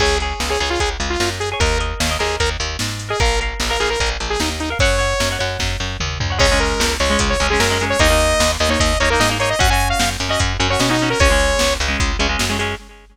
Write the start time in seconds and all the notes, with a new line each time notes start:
0.00 C#2 G#4 C#5, kick, crash
0.20 G#4 C#5, closed hi-hat
0.40 C#2, snare
0.50 G#4 C#5
0.60 C#2 G#4 C#5, closed hi-hat
0.70 F4
0.80 C#2 G#4, kick, closed hi-hat
1.00 C#2, closed hi-hat
1.10 F4
1.20 F#2 F4, snare
1.40 G#4, closed hi-hat
1.52 G#4 C#5
1.60 D#2 A#4 D#5, kick, closed hi-hat
1.79 A#4 D#5, closed hi-hat
2.00 D#2, snare
2.09 A#4 D#5
2.19 D#2 G#4 A#4 D#5, closed hi-hat
2.40 D#2 A#4, kick, closed hi-hat
2.60 D#2, closed hi-hat
2.79 G#2, snare
2.99 closed hi-hat
3.09 G#4 A#4 D#5
3.20 A#1 A#4 F5, kick, closed hi-hat
3.41 A#4 F5, closed hi-hat
3.60 A#1, snare
3.69 A#4 F5
3.80 A#1 G#4 A#4 F5, closed hi-hat
3.90 A#4
4.00 A#1 A#4, kick, closed hi-hat
4.20 A#1, closed hi-hat
4.30 G#4
4.40 D#2 D#4, snare
4.60 D#4, closed hi-hat
4.70 A#4 F5
4.79 F#2 C#5 F#5, kick, closed hi-hat
4.99 C#5 F#5, closed hi-hat
5.20 F#2, snare
5.31 C#5 F#5
5.39 F#2 C#5 F#5, closed hi-hat
5.59 F#2, kick, snare
5.80 F#2
6.00 D#2, mid tom
6.20 D2, floor tom
6.30 C#5 F#5
6.39 C#2 G#3 C#4 C#5, kick, crash
6.52 G#3 C#4
6.60 A#4, closed hi-hat
6.80 C#2, snare
7.00 C#2 C#5, closed hi-hat
7.10 G#3 C#4
7.19 C#2, kick, closed hi-hat
7.30 C#5
7.40 C#2 G#3 C#4, closed hi-hat
7.50 G#3 C#4 G#4
7.60 F#2 A#4, snare
7.70 G#3 C#4
7.80 G#3 C#4, closed hi-hat
7.90 C#5
7.99 D#2 A#3 D#4 D#5, kick, closed hi-hat
8.10 A#3 D#4
8.20 closed hi-hat
8.40 D#2, snare
8.59 D#2 D#5, closed hi-hat
8.69 A#3 D#4 C#5
8.80 D#2 D#5, kick, closed hi-hat
9.00 D#2 A#3 D#4 C#5, closed hi-hat
9.10 A#3 D#4 A#4
9.20 G#2 D#5, snare
9.30 A#3 D#4
9.39 A#3 D#4 C#5, closed hi-hat
9.50 D#5
9.59 F#2 C#4 F#4 F#5, kick, closed hi-hat
9.70 C#4 F#4 G#5
9.80 closed hi-hat
9.90 F5
10.00 F#2 F5, snare
10.20 F#2, closed hi-hat
10.29 C#4 F#4 D#5
10.40 F#2, kick, closed hi-hat
10.60 F#2 C#4 F#4, closed hi-hat
10.70 C#4 F#4 C#5
10.80 B2 C#4, snare
10.89 C#4 D#4 F#4
10.99 C#4, closed hi-hat
11.04 F#4
11.10 A#4
11.20 C#2 G#3 C#4 C#5, kick, closed hi-hat
11.30 G#3 C#4
11.40 closed hi-hat
11.59 C#2, snare
11.80 C#2, closed hi-hat
11.88 G#3 C#4
12.00 C#2, kick, closed hi-hat
12.19 C#2 G#3 C#4, closed hi-hat
12.29 G#3 C#4
12.39 F#2, snare
12.50 G#3 C#4
12.59 G#3 C#4, closed hi-hat